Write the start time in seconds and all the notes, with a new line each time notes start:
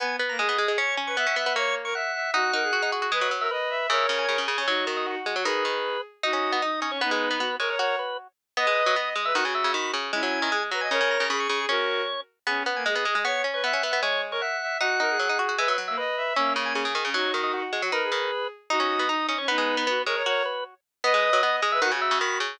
0.00 B3 G#5
0.19 B3
0.29 A#3 A#5
0.39 G#3 G#4 D#5
0.49 B3
0.58 G#3 G#4
0.68 G#3
0.78 C#4 C#5 C#6
0.97 C#4
1.07 B4 C#6
1.17 B3 E5 F#5
1.27 C#4
1.36 B3 E5
1.46 B3
1.56 A#3 C#5 C#6
1.84 A#4 C#6
1.95 E5 F#5
2.14 E5
2.34 D#4 F#4 F#5
2.53 D#4 A#4
2.62 G#4
2.73 F#4
2.82 D#4
2.92 F#4
3.02 F#4
3.12 G#3 B4 D#5
3.21 F#3
3.31 F#3
3.41 A#4 E5
3.51 B4 D#5
3.70 E5
3.90 C#3 A#4 C#5 E5
4.09 C#3
4.19 G#5
4.28 C#3 G#4
4.38 C#3
4.48 C#3
4.58 C#3 C#5
4.67 F#3 D#4 F#4 C#5
4.87 D#3
4.97 D#5
5.06 F#4
5.26 G#3
5.35 F#3 F#4
5.45 D#3 G#4 B4
5.55 G#4
5.65 D#3
6.23 D#4 F#4 D#5
6.33 C#4
6.52 B3
6.62 D#4
6.82 C#4 D#5
6.91 C#4 C#5
7.01 B3 D#4 B4
7.11 G#3
7.31 B3
7.39 B3 F#4
7.60 G#3 A#4 C#5
7.69 A#4 C#5
7.79 F#4 A#4 C#5
7.99 B4
8.57 B3 B4 D#5
8.67 G#3
8.86 F#3
8.96 B3 D#5
9.16 G#3 D#5
9.25 B4 E5
9.35 D#3 F#4 F#5
9.45 C#3 F#4 G#5
9.55 E5
9.64 C#3
9.74 D#3 B5
9.94 C#3
10.13 G#3 C#4 E4 G#5
10.23 F#3
10.42 D#3
10.52 G#3 G#4
10.71 F#3 B4 A#5
10.81 D#5 G#5
10.91 C#3 A#4 C#5
11.01 C#3 G#5
11.11 A#5
11.20 C#3
11.30 C#3 G#4 B5
11.40 C#6
11.49 C#3 C#6
11.60 G#4
11.69 C#4 F#4 A#4 C#5
12.47 B3 C#4 G#4
12.66 B3
12.76 A#3 G#5
12.86 G#3 G#4 D#5
12.95 B3
13.04 G#3 G#4
13.15 G#3
13.25 B3 C#5 C#6
13.44 C#4
13.53 B4 C#5
13.63 B3 E5 F#5
13.73 C#4
13.82 B3 E5
13.93 B3
14.03 G#3 C#5
14.31 A#4 C#5
14.40 E5 F#5
14.61 E5
14.80 D#4 F#4 F#5
15.00 D#4 A#4
15.10 G#4
15.19 F#3
15.29 D#4
15.39 F#4
15.49 F#4
15.58 G#3 B4 E5
15.68 F#3
15.78 F#3
15.88 A#3 E5
15.97 B4 D#5
16.17 E5
16.36 A#3 C#4 E5
16.56 C#3
16.66 G#5
16.75 C#3 G#4
16.85 C#3
16.95 D#3
17.05 C#3 C#4
17.14 F#3 D#4 F#4 C#5
17.34 D#3
17.43 D#5
17.53 F#4
17.73 G#3
17.82 F#3 F#4
17.92 D#4 A#4 B4
18.03 G#4
18.12 D#3
18.70 D#4 F#4 D#5
18.80 C#4
18.99 B3
19.09 D#4
19.29 C#4 D#5
19.38 C#4 C#5
19.48 B3 D#4 B4
19.58 G#3
19.77 B3
19.87 B3 F#4
20.06 G#3 A#4 C#5
20.16 A#4 C#5
20.26 F#4 A#4 C#5
20.45 B4
21.04 B3 B4 D#5
21.14 G#3
21.33 F#3
21.43 B3 D#5
21.62 G#3 D#5
21.72 B4 E5
21.82 D#3 F#4 F#5
21.91 C#3 F#4 G#5
22.01 E5
22.11 C#3
22.21 D#3 B5
22.40 C#3